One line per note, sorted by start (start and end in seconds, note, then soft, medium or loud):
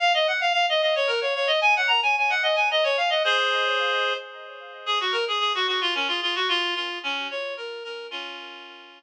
0.00 0.12 F5 loud
0.14 0.27 D#5 loud
0.27 0.40 F#5 medium
0.41 0.52 F5 loud
0.53 0.66 F5 loud
0.69 0.82 D#5 loud
0.82 0.95 D#5 medium
0.95 1.08 C#5 loud
1.07 1.20 A#4 medium
1.21 1.34 C#5 medium
1.35 1.48 C#5 medium
1.47 1.60 D#5 loud
1.61 1.74 G#5 loud
1.76 1.89 F#5 loud
1.87 2.00 A#5 loud
2.03 2.16 G#5 loud
2.18 2.31 G#5 medium
2.30 2.43 F#5 loud
2.43 2.56 D#5 medium
2.56 2.68 G#5 medium
2.71 2.84 D#5 loud
2.84 2.97 C#5 loud
2.97 3.10 F5 medium
3.10 3.23 D#5 medium
3.24 4.13 G#4 medium
3.24 4.13 C5 loud
4.86 4.99 G#4 loud
5.00 5.13 F#4 medium
5.12 5.25 A#4 medium
5.28 5.39 G#4 medium
5.40 5.52 G#4 medium
5.55 5.67 F#4 loud
5.67 5.80 F#4 medium
5.81 5.94 F4 loud
5.95 6.08 C#4 medium
6.08 6.20 F4 medium
6.22 6.35 F4 medium
6.35 6.48 F#4 loud
6.48 6.74 F4 loud
6.75 6.98 F4 medium
7.03 7.27 C#4 loud
7.31 7.54 C#5 medium
7.57 7.83 A#4 medium
7.84 8.07 A#4 medium
8.11 8.99 C#4 loud
8.11 8.99 F4 loud